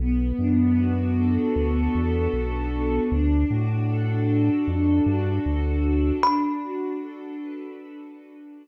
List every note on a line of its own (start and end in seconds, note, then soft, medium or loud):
0.00 0.33 B1 loud
0.00 2.33 B3 medium
0.39 1.38 F#2 medium
0.39 1.94 D4 medium
0.78 1.56 F#4 medium
1.17 3.02 A4 medium
1.56 1.89 D2 medium
1.56 3.04 F#4 medium
1.95 2.28 E2 medium
1.95 2.72 D4 medium
2.34 3.00 B1 medium
2.34 3.08 B3 medium
2.73 3.10 D4 medium
3.12 3.45 D2 loud
3.12 4.67 D4 medium
3.50 4.50 A2 loud
3.50 4.28 F#4 medium
3.90 5.45 A4 medium
4.29 5.06 F#4 medium
4.68 5.01 F2 medium
4.68 6.16 D4 medium
5.06 5.39 G2 medium
5.06 5.84 F#4 medium
5.45 6.12 D2 medium
5.45 6.19 A4 medium
5.84 6.21 F#4 medium
6.23 8.56 D4 medium
6.23 8.67 B5 medium
6.62 8.18 F#4 medium
7.01 7.79 A4 medium
7.40 8.67 B4 medium
7.79 8.67 A4 medium
8.18 8.67 F#4 medium
8.57 8.67 D4 medium